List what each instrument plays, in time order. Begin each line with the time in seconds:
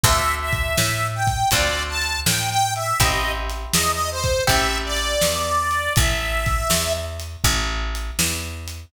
0.04 electric bass (finger) D2, acoustic guitar (steel) C4 D4 F4 A4, harmonica E5, kick, closed hi-hat
0.41 harmonica E5
0.52 kick, closed hi-hat
0.77 electric bass (finger) A2, snare
1.15 harmonica G5
1.27 kick, closed hi-hat
1.51 electric bass (finger) D2, acoustic guitar (steel) C4 D4 F4 A4, harmonica D5, kick, closed hi-hat
1.89 harmonica A5
2.02 closed hi-hat
2.26 electric bass (finger) A2, harmonica G5, snare
2.51 harmonica G5
2.75 harmonica E5, closed hi-hat
3.00 electric bass (finger) A1, acoustic guitar (steel) C4 E4 G4 A4, harmonica D#5, kick, closed hi-hat
3.50 closed hi-hat
3.73 electric bass (finger) E2, harmonica D#5, snare
3.92 harmonica D#5
4.11 harmonica C5
4.24 kick, closed hi-hat
4.47 electric bass (finger) A1, acoustic guitar (steel) C4 E4 G4 A4, harmonica E5, kick, closed hi-hat
4.85 harmonica D5
4.96 closed hi-hat
5.21 electric bass (finger) E2, snare
5.71 closed hi-hat
5.96 electric bass (finger) A1, harmonica E5, kick, closed hi-hat
6.46 kick, closed hi-hat
6.70 electric bass (finger) E2, snare
7.20 closed hi-hat
7.44 electric bass (finger) A1, kick, closed hi-hat
7.95 closed hi-hat
8.19 electric bass (finger) E2, snare
8.68 closed hi-hat